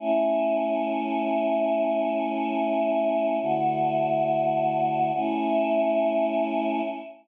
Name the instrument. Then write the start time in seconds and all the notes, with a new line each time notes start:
choir aahs
0.00 A3 C#4 E4
3.42 D3 A3 E4 F#4
5.14 A3 C#4 E4